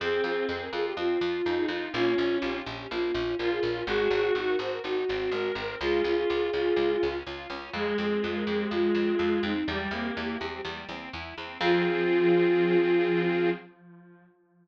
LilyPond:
<<
  \new Staff \with { instrumentName = "Flute" } { \time 4/4 \key f \minor \tempo 4 = 124 aes'8 aes'8 r16 bes'16 aes'16 g'16 f'4. ees'8 | f'4 g'4 f'4 bes'16 aes'16 bes'8 | aes'8 aes'8 r16 bes'16 c''16 bes'16 ges'4. bes'8 | aes'2. r4 |
aes'8 aes'8 r16 bes'16 aes'16 g'16 f'4. ees'8 | g'2 r2 | f'1 | }
  \new Staff \with { instrumentName = "Clarinet" } { \time 4/4 \key f \minor c'4. r4. ees'4 | des'4. r4. f'4 | ges'4. r4. bes'4 | f'4. f'4. r4 |
aes1 | g16 g16 bes4 r2 r8 | f1 | }
  \new Staff \with { instrumentName = "Accordion" } { \time 4/4 \key f \minor c'8 f'8 aes'8 f'8 c'8 f'8 aes'8 f'8 | bes8 des'8 f'8 des'8 bes8 des'8 f'8 des'8 | aes8 c'8 ees'8 ges'8 ees'8 c'8 aes8 c'8 | aes8 des'8 f'8 des'8 aes8 des'8 f'8 des'8 |
aes8 c'8 f'8 c'8 aes8 c'8 f'8 c'8 | g8 c'8 e'8 c'8 g8 c'8 e'8 c'8 | <c' f' aes'>1 | }
  \new Staff \with { instrumentName = "Harpsichord" } { \clef bass \time 4/4 \key f \minor f,8 f,8 f,8 f,8 f,8 f,8 f,8 f,8 | bes,,8 bes,,8 bes,,8 bes,,8 bes,,8 bes,,8 bes,,8 bes,,8 | aes,,8 aes,,8 aes,,8 aes,,8 aes,,8 aes,,8 aes,,8 aes,,8 | des,8 des,8 des,8 des,8 des,8 des,8 des,8 des,8 |
f,8 f,8 f,8 f,8 f,8 f,8 f,8 f,8 | e,8 e,8 e,8 e,8 e,8 e,8 e,8 e,8 | f,1 | }
>>